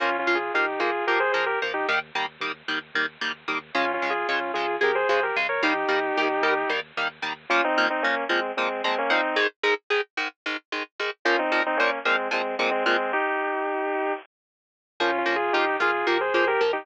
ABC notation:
X:1
M:7/8
L:1/16
Q:1/4=112
K:Bbdor
V:1 name="Distortion Guitar"
(3[DF]2 [DF]2 [FA]2 [EG]2 [FA]2 [GB] [Ac] [Ac] [GB] z [EG] | z14 | (3[DF]2 [DF]2 [FA]2 [DF]2 [FA]2 [GB] [Ac] [Ac] [GB] z [Bd] | [EG]10 z4 |
[DF] [CE]2 [CE] [B,D]2 [A,C]2 [A,C]2 [A,C] [B,D] [CE]2 | z14 | [DF] [CE]2 [CE] [B,D]2 [A,C]2 [A,C]2 [A,C] [A,C] [A,C]2 | [EG]8 z6 |
(3[DF]2 [DF]2 [FA]2 [EG]2 [FA]2 [GB] [Ac] [Ac] [GB] z [EG] |]
V:2 name="Overdriven Guitar"
[F,B,]2 [F,B,]2 [F,B,]2 [F,B,]2 [F,B,]2 [F,B,]2 [F,B,]2 | [E,G,B,]2 [E,G,B,]2 [E,G,B,]2 [E,G,B,]2 [E,G,B,]2 [E,G,B,]2 [E,G,B,]2 | [D,A,]2 [D,A,]2 [D,A,]2 [D,A,]2 [D,A,]2 [D,A,]2 [D,A,]2 | [E,G,B,]2 [E,G,B,]2 [E,G,B,]2 [E,G,B,]2 [E,G,B,]2 [E,G,B,]2 [E,G,B,]2 |
[B,,F,B,]2 [B,,F,B,]2 [B,,F,B,]2 [B,,F,B,]2 [B,,F,B,]2 [B,,F,B,]2 [B,,F,B,]2 | [A,,E,A,]2 [A,,E,A,]2 [A,,E,A,]2 [A,,E,A,]2 [A,,E,A,]2 [A,,E,A,]2 [A,,E,A,]2 | [B,,F,B,]2 [B,,F,B,]2 [B,,F,B,]2 [B,,F,B,]2 [B,,F,B,]2 [B,,F,B,]2 [B,,F,B,]2 | z14 |
[F,B,]2 [F,B,]2 [F,B,]2 [F,B,]2 [F,B,]2 [F,B,]2 [F,B,]2 |]
V:3 name="Synth Bass 1" clef=bass
B,,,2 B,,,2 B,,,2 B,,,2 B,,,2 B,,,2 B,,,2 | E,,2 E,,2 E,,2 E,,2 E,,2 E,,2 E,,2 | D,,2 D,,2 D,,2 D,,2 D,,2 D,,2 D,,2 | E,,2 E,,2 E,,2 E,,2 E,,2 E,,2 E,,2 |
z14 | z14 | z14 | z14 |
B,,,2 B,,,2 B,,,2 B,,,2 B,,,2 B,,,2 B,,,2 |]